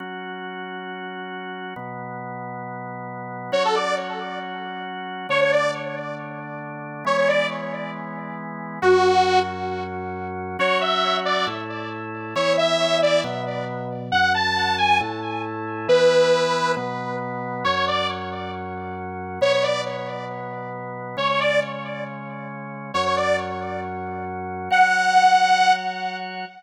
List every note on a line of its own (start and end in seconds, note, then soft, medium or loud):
0.00 1.74 F#3 medium
0.00 1.74 C#4 medium
0.00 1.74 F#4 medium
1.76 3.51 B2 medium
1.76 3.51 F#3 medium
1.76 3.51 B3 medium
3.52 5.27 F#3 medium
3.52 5.27 C#4 medium
3.52 5.27 F#4 medium
3.52 3.63 C#5 medium
3.65 3.75 A4 medium
3.74 3.95 D5 medium
5.29 7.04 D3 medium
5.29 7.04 A3 medium
5.29 7.04 D4 medium
5.29 5.40 C#5 medium
5.41 5.51 C#5 medium
5.52 5.71 D5 medium
7.05 8.79 E3 medium
7.05 8.79 G#3 medium
7.05 8.79 B3 medium
7.05 7.17 C#5 medium
7.18 7.28 C#5 medium
7.28 7.47 D5 medium
8.82 10.57 F#2 medium
8.82 10.57 F#3 medium
8.82 10.57 C#4 medium
8.82 9.40 F#4 medium
10.59 11.46 F#3 loud
10.59 11.46 C#4 medium
10.59 11.46 F#4 loud
10.59 10.79 C#5 medium
10.81 11.17 E5 medium
11.25 11.45 D5 medium
11.47 12.34 A2 medium
11.47 12.34 A3 medium
11.47 12.34 E4 medium
12.35 13.23 E3 loud
12.35 13.23 B3 medium
12.35 13.23 E4 loud
12.35 12.53 C#5 medium
12.57 12.98 E5 medium
13.02 13.21 D5 medium
13.24 14.11 B2 loud
13.24 14.11 F#3 medium
13.24 14.11 B3 medium
14.12 15.00 F#2 medium
14.12 15.00 F#3 loud
14.12 15.00 C#4 medium
14.12 14.32 F#5 medium
14.34 14.76 A5 medium
14.78 14.98 G#5 medium
15.00 15.88 A2 loud
15.00 15.88 A3 medium
15.00 15.88 E4 loud
15.88 16.75 E3 loud
15.88 16.75 B3 loud
15.88 16.75 E4 medium
15.88 16.72 B4 medium
16.77 17.64 B2 medium
16.77 17.64 F#3 medium
16.77 17.64 B3 loud
17.64 19.40 F#2 medium
17.64 19.40 F#3 medium
17.64 19.40 C#4 medium
17.64 17.75 C#5 medium
17.75 17.86 C#5 medium
17.87 18.07 D5 medium
19.41 21.16 B2 medium
19.41 21.16 F#3 medium
19.41 21.16 B3 medium
19.41 19.52 C#5 medium
19.53 19.63 C#5 medium
19.63 19.81 D5 medium
21.17 22.92 C#3 medium
21.17 22.92 G#3 medium
21.17 22.92 C#4 medium
21.17 21.28 C#5 medium
21.29 21.40 C#5 medium
21.40 21.60 D5 medium
22.94 24.69 F#2 medium
22.94 24.69 F#3 medium
22.94 24.69 C#4 medium
22.94 23.05 C#5 medium
23.06 23.16 C#5 medium
23.16 23.37 D5 medium
24.70 26.45 F#3 medium
24.70 26.45 F#4 medium
24.70 26.45 C#5 medium
24.70 25.73 F#5 medium